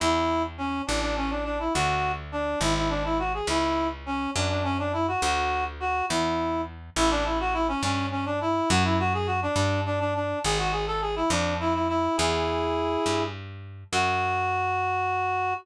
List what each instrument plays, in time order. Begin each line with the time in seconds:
0.00 electric bass (finger) E2, clarinet E4
0.58 clarinet C#4
0.87 electric bass (finger) A1, clarinet D4
1.01 clarinet D4
1.17 clarinet C#4
1.30 clarinet D4
1.44 clarinet D4
1.60 clarinet E4
1.74 electric bass (finger) D2, clarinet F#4
2.32 clarinet D4
2.60 electric bass (finger) G#1, clarinet E4
2.76 clarinet E4
2.89 clarinet D4
3.05 clarinet E4
3.19 clarinet F#4
3.34 clarinet G#4
3.47 electric bass (finger) C#2, clarinet E4
4.06 clarinet C#4
4.36 electric bass (finger) F#2, clarinet D4
4.49 clarinet D4
4.64 clarinet C#4
4.79 clarinet D4
4.93 clarinet E4
5.08 clarinet F#4
5.22 electric bass (finger) D2, clarinet F#4
5.80 clarinet F#4
6.09 electric bass (finger) E2, clarinet E4
6.96 electric bass (finger) A1, clarinet E4
7.10 clarinet D4
7.25 clarinet E4
7.40 clarinet F#4
7.54 clarinet E4
7.68 clarinet C#4
7.83 electric bass (finger) G2, clarinet C#4
8.11 clarinet C#4
8.26 clarinet D4
8.41 clarinet E4
8.70 electric bass (finger) F#2, clarinet F#4
8.84 clarinet E4
8.99 clarinet F#4
9.14 clarinet G#4
9.26 clarinet F#4
9.42 clarinet D4
9.56 electric bass (finger) G2, clarinet D4
9.86 clarinet D4
10.00 clarinet D4
10.15 clarinet D4
10.44 electric bass (finger) G#1, clarinet G#4
10.58 clarinet F#4
10.72 clarinet G#4
10.87 clarinet A4
11.01 clarinet G#4
11.16 clarinet E4
11.30 electric bass (finger) F2, clarinet D4
11.60 clarinet E4
11.74 clarinet E4
11.88 clarinet E4
12.17 electric bass (finger) E2, clarinet E4 G#4
13.06 electric bass (finger) G2
13.92 electric bass (finger) F#2, clarinet F#4